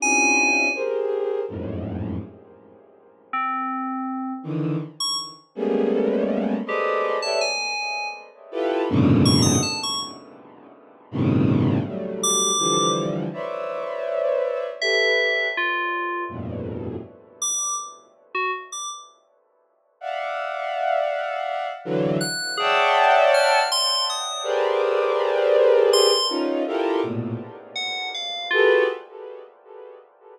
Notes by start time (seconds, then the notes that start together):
0.00 C4 C#4 D4 E4 F4 G4 G#5
0.74 G4 G#4 A#4 C5
1.49 F2 F#2 G#2 A2
3.33 C4
4.43 D3 D#3 E3
5.00 C#6
5.55 G3 G#3 A3 A#3 B3 C#4
6.66 G4 G#4 A4 B4 C5 D5 D#5
7.22 G4 A4 B4 C#5 D5 E5 A5
7.41 G#5
8.51 E4 F4 G4 A4 B4
8.89 F#2 G#2 A#2 B2 C#3 D3
9.25 C#6
9.42 D#6
9.63 A5
9.83 C#6
11.11 G2 A2 B2 C3 C#3 D#3
11.85 F#3 G3 A3
12.23 D6
12.59 D3 E3 F3 G3
13.33 B4 C5 C#5 D5 E5
14.81 G4 A4 B4 E5
15.57 F4
16.29 F2 G2 A2 A#2 B2
17.42 D6
18.35 F#4
18.72 D6
20.01 D5 E5 F5 F#5
21.85 D3 E3 F#3
22.21 F#6
22.57 G#4 C#5 D5 E5 F#5 G5 A5
23.34 F6
23.72 C6
24.10 D#6
24.43 G4 G#4 A#4 B4 C5 D5
25.93 C6
26.29 C#4 D#4 F4
26.67 E4 F4 G4 A4 A#4
27.03 A2 A#2 B2
27.76 F#5
28.14 F5
28.51 F4 F#4 G4 G#4 A4 B4